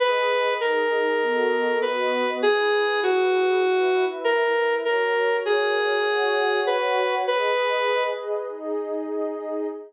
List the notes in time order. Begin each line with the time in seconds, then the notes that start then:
0.00 G#4 B4 D#5
0.61 D#4 G#4 A#4 D#5
1.21 B3 F#4 A4 D#5
1.82 B3 F#4 B4 D#5
2.42 E4 G#4 B4
3.03 F#4
3.64 E4 B4 E5
4.24 A#4
4.85 F#4 A#4 C#5
5.45 G#4
6.06 F#4 C#5 F#5
6.67 B4
7.27 G#4 B4 D#5
8.48 D#4 G#4 D#5